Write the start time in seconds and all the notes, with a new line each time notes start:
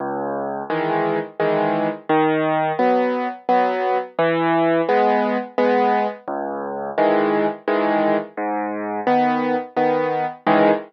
0.00 C#2
0.70 D#3 E3 G#3
1.40 D#3 E3 G#3
2.09 D#3
2.79 F#3 B3
3.49 F#3 B3
4.19 E3
4.89 G#3 B3
5.58 G#3 B3
6.28 C#2
6.98 D#3 E3 G#3
7.68 D#3 E3 G#3
8.37 G#2
9.07 D#3 B3
9.77 D#3 B3
10.47 C#2 D#3 E3 G#3